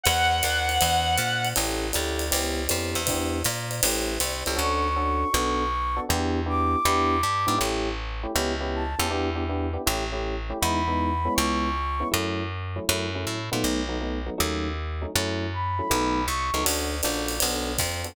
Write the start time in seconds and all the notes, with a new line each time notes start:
0.03 E2 F#5, ride
0.43 D#2, hi-hat pedal, ride
0.69 ride
0.81 E2, ride
1.18 A#2, hi-hat pedal, ride
1.45 ride
1.56 A1 C#4 E4 G4 A4, ride
1.93 D2 C#4 E4 G4 A4, hi-hat pedal, ride
2.19 ride
2.31 C#2 B3 C#4 E4 G4, ride
2.69 F2 B3 C#4 E4 G4, hi-hat pedal, ride
2.95 E2, ride
3.07 B3 D4 E4 G4, kick, ride
3.44 A#2, hi-hat pedal, ride
3.71 ride
3.83 A1 A3 C#4 E4 G4, ride
4.20 C2, hi-hat pedal, ride
4.46 C#2 A3 C#4 E4 G4, ride
4.56 D2 C#4 D4 F#4 A4 C#6
4.96 C#4 D4 F#4 A4
5.33 B1 B3 D4 F#4 A4
5.96 B3 D4 F#4 A4
6.09 E2 B3 D4 E4 G4
6.46 B3 D4 E4 G4 D6
6.85 E2 B3 D4 E4 G4
7.23 G2
7.47 G#2 B3 D4 E4 G4
7.58 A1 A3 C#4 E4 G4
8.23 A3 C#4 E4 G4
8.35 C#2 B3 C#4 E4 G4
8.60 B3 C#4 E4 G4
8.75 A5
8.99 E2 B3 C#4 E4 G4
9.11 B3 D4 E4 G4
9.35 B3 D4 E4 G4
9.49 B3 D4 E4 G4
9.73 B3 D4 E4 G4
9.86 A1 A3 C#4 E4 G4
10.12 A3 C#4 E4 G4
10.50 A3 C#4 E4 G4
10.60 E2 G#3 B3 D#4 E4 B5
10.88 G#3 B3 D#4 E4
11.25 G#3 B3 C#4 E4
11.35 C#2 C#6
12.00 G#3 B3 C#4 E4
12.11 F#2 F#3 A3 C#4 E4
12.76 F#3 A3 C#4 E4
12.89 F#2 F#3 A3 C#4 E4
13.15 F#3 A3 C#4 E4
13.27 A2
13.51 A#2 F#3 A3 B3 D#4
13.64 B1
13.89 F#3 A3 B3 D#4
14.01 F#3 A3 B3 D#4
14.26 F#3 A3 B3 D#4
14.38 D#2 F#3 A3 C#4 D#4
15.02 F#3 A3 C#4 D#4
15.15 F#2 F#3 A3 C#4 E4
15.53 B5
15.79 F#3 A3 C#4 E4
15.90 B1 F#3 A3 B3 D#4
16.27 C2 C#6
16.54 C#2 F#3 A3 B3 D#4
16.64 D2 C#4 D4 F#4 A4, ride
17.03 A#1 C#4 D4 F#4 A4, hi-hat pedal, ride
17.28 ride
17.40 B1 B3 D4 F#4 A4, ride
17.78 F2, kick, hi-hat pedal, ride
18.04 B3 D4 F#4 A4, ride